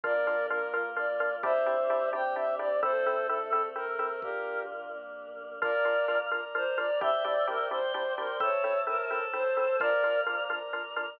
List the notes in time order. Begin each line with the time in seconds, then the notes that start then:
0.03 A#1 A#3 D4 F4 A#4 D5, kick
0.27 D4 F4 A#4
0.50 D4 F4 A#4
0.73 A#1 A#3 D4 F4 A#4
0.96 D4 F4 A#4 D5
1.20 D4 F4 A#4
1.43 A#1 C4 D4 E4 G4 C5 E5, kick
1.66 C4 D4 E4 G4
1.90 C4 D4 E4 G4
2.12 A#1 C4 D4 E4 G4 C5 G5
2.35 C4 D4 E4 G4 E5
2.59 C4 D4 E4 G4 D5
2.82 A#1 C4 E4 A4 C5, kick
3.06 C4 E4 A4
3.29 C4 E4 A4
3.52 A#1 A3 C4 E4 A4
3.76 C4 E4 A4 A#4
3.99 C4 E4 A4
4.22 A#1 D4 F4 G4 A#4, kick
4.92 C2 A#3 D4 A#4
5.26 B1
5.61 A#1 D4 F4 A#4 D5 F5 A#5, kick
5.85 D4 F4 A#4
6.08 D4 F4 A#4
6.31 A#1 D4 F4 A#4 D5 A#5
6.55 D4 F4 A#4 C5
6.78 D4 F4 A#4 D5
7.01 A#1 C4 D4 E4 G4 C5 D5 E5 G5, kick
7.25 C4 D4 E4 G4 D5
7.47 C4 D4 E4 G4 A#4
7.71 A#1 C4 D4 E4 G4 C5 D5 G5 C6
7.94 C4 D4 E4 G4 C5
8.18 C4 D4 E4 G4 A#4
8.40 A#1 C4 E4 A4 C5 C#5 E5 A5, kick
8.64 C4 E4 A4
8.87 C4 E4 A4 A#4
9.10 A#1 C4 E4 A4 C5 A5
9.33 C4 E4 A4 C5
9.57 C4 E4 A4
9.80 A#1 D4 F4 A#4 D5 F5 A#5, kick
10.04 D4 F4 A#4
10.26 D4 F4 A#4
10.50 A#1 D4 F4 A#4 D5 A#5
10.73 D4 F4 A#4
10.96 D4 F4 A#4